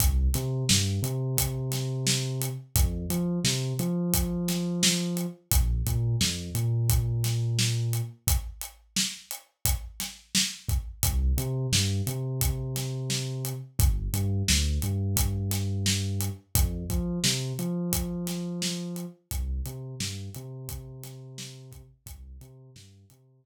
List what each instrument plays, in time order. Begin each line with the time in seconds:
0.00 synth bass 2 C2, kick, closed hi-hat
0.34 synth bass 2 C3, snare, closed hi-hat
0.69 synth bass 2 G2, snare
1.02 synth bass 2 C3, closed hi-hat
1.38 kick, closed hi-hat
1.72 snare, closed hi-hat
2.07 snare
2.42 closed hi-hat
2.76 synth bass 2 F2, kick, closed hi-hat
3.10 synth bass 2 F3, closed hi-hat
3.44 synth bass 2 C3, snare
3.79 synth bass 2 F3, closed hi-hat
4.14 kick, closed hi-hat
4.48 snare, closed hi-hat
4.83 snare
5.17 closed hi-hat
5.52 synth bass 2 A#1, kick, closed hi-hat
5.86 synth bass 2 A#2, kick, closed hi-hat
6.21 synth bass 2 F2, snare
6.55 synth bass 2 A#2, closed hi-hat
6.89 kick, closed hi-hat
7.24 snare, closed hi-hat
7.59 snare
7.93 closed hi-hat
8.27 kick, closed hi-hat
8.61 closed hi-hat
8.96 snare
9.31 closed hi-hat
9.65 kick, closed hi-hat
10.00 snare, closed hi-hat
10.35 snare
10.69 kick, closed hi-hat
11.03 synth bass 2 C2, kick, closed hi-hat
11.37 synth bass 2 C3, closed hi-hat
11.72 synth bass 2 G2, snare
12.07 synth bass 2 C3, closed hi-hat
12.41 kick, closed hi-hat
12.76 snare, closed hi-hat
13.10 snare
13.45 closed hi-hat
13.79 synth bass 2 G1, kick, closed hi-hat
14.13 synth bass 2 G2, closed hi-hat
14.48 synth bass 2 D2, snare
14.82 synth bass 2 G2, closed hi-hat
15.17 kick, closed hi-hat
15.51 snare, closed hi-hat
15.86 snare
16.21 closed hi-hat
16.55 synth bass 2 F2, kick, closed hi-hat
16.90 synth bass 2 F3, kick, closed hi-hat
17.24 synth bass 2 C3, snare
17.59 synth bass 2 F3, closed hi-hat
17.93 kick, closed hi-hat
18.27 snare, closed hi-hat
18.62 snare
18.96 closed hi-hat
19.31 synth bass 2 C2, kick, closed hi-hat
19.66 synth bass 2 C3, closed hi-hat
20.00 synth bass 2 G2, snare
20.34 synth bass 2 C3, closed hi-hat
20.69 kick, closed hi-hat
21.04 snare, closed hi-hat
21.38 snare
21.72 kick, closed hi-hat
22.06 synth bass 2 C2, kick, closed hi-hat
22.41 synth bass 2 C3, closed hi-hat
22.76 synth bass 2 G2, snare
23.10 synth bass 2 C3, closed hi-hat
23.44 kick